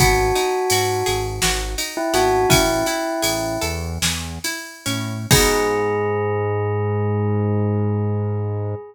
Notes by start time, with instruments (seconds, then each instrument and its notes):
0.00 synth bass 1 G#1, acoustic guitar (steel) B3, tubular bells F#4, kick, ride
0.35 acoustic guitar (steel) D#4, ride
0.70 synth bass 1 G#2, acoustic guitar (steel) F#4, ride
1.06 synth bass 1 G#1, acoustic guitar (steel) G#4, ride
1.42 synth bass 1 G#1, acoustic guitar (steel) F#4, snare
1.78 acoustic guitar (steel) D#4, ride
1.97 tubular bells E4
2.14 synth bass 1 G#1, acoustic guitar (steel) B3, tubular bells F#4, ride
2.49 synth bass 1 A1, acoustic guitar (steel) C#4, tubular bells E4, kick, ride
2.86 acoustic guitar (steel) E4, ride
3.22 synth bass 1 A1, acoustic guitar (steel) G#4, ride
3.61 synth bass 1 E2, acoustic guitar (steel) A4, ride
4.02 synth bass 1 E2, acoustic guitar (steel) G#4, snare
4.44 acoustic guitar (steel) E4, ride
4.86 synth bass 1 A2, acoustic guitar (steel) C#4, ride
5.31 synth bass 1 G#2, acoustic guitar (steel) B3 D#4 F#4 G#4, tubular bells G#4, kick, crash